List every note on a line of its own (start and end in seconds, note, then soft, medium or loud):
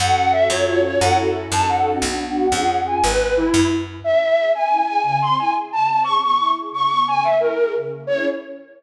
0.00 0.46 F#2 loud
0.00 0.46 C#4 loud
0.00 0.46 F#4 medium
0.00 0.46 A4 loud
0.00 0.14 F#5 medium
0.15 0.31 F#5 medium
0.32 0.48 E5 medium
0.50 0.96 F#2 loud
0.50 0.98 C#4 medium
0.50 0.98 F4 loud
0.50 0.98 F#4 medium
0.50 0.98 A4 loud
0.50 0.64 C#5 medium
0.67 0.81 C#5 medium
0.84 1.00 C#5 medium
1.00 1.48 F#2 loud
1.00 1.45 C#4 medium
1.00 1.45 E4 loud
1.00 1.45 F#4 loud
1.00 1.45 A4 loud
1.00 1.15 F#5 medium
1.52 1.98 F#2 loud
1.52 1.98 C#4 loud
1.52 1.98 D#4 loud
1.52 1.98 F#4 medium
1.52 1.98 A4 loud
1.52 1.67 A5 medium
1.69 1.96 F#5 medium
2.00 2.48 B1 loud
2.00 2.46 B3 medium
2.00 2.46 D4 medium
2.00 2.46 F#4 medium
2.00 2.79 F#5 medium
2.52 2.98 F2 medium
2.52 2.97 C#4 medium
2.52 2.97 F4 loud
2.52 2.97 G#4 loud
2.87 3.01 G#5 medium
3.04 3.50 G#1 loud
3.04 3.34 B4 medium
3.37 3.68 E4 medium
3.54 4.00 F#2 loud
4.03 4.18 C#4 medium
4.03 4.49 E5 medium
4.20 4.35 E4 medium
4.36 4.51 G#4 medium
4.54 4.69 C#4 medium
4.54 4.86 G#5 medium
4.70 4.85 E4 medium
4.86 5.03 G#4 medium
4.86 5.01 G#5 medium
5.03 5.18 C#3 medium
5.03 5.19 G#5 medium
5.20 5.35 C4 medium
5.20 5.36 C6 medium
5.39 5.54 E4 medium
5.39 5.52 G#5 medium
5.53 5.68 G#4 medium
5.72 5.87 C#3 medium
5.72 5.87 A5 medium
5.87 6.03 C4 medium
5.87 6.01 A5 medium
6.04 6.20 C#3 medium
6.04 6.18 C#6 medium
6.22 6.38 B3 medium
6.22 6.36 C#6 medium
6.37 6.54 E4 medium
6.37 6.51 C#6 medium
6.55 6.70 G#4 medium
6.71 6.86 C#3 medium
6.71 6.88 C#6 medium
6.88 7.05 B3 medium
6.88 7.04 C#6 medium
7.06 7.21 C#3 medium
7.06 7.23 G#5 medium
7.23 7.39 A#3 medium
7.23 7.37 E5 medium
7.39 7.54 E4 medium
7.39 7.72 A#4 medium
7.57 7.72 G#4 medium
7.74 7.89 C#3 medium
7.90 8.05 A#3 soft
8.07 8.25 C#4 medium
8.07 8.25 E4 medium
8.07 8.25 G#4 medium
8.07 8.24 C#5 loud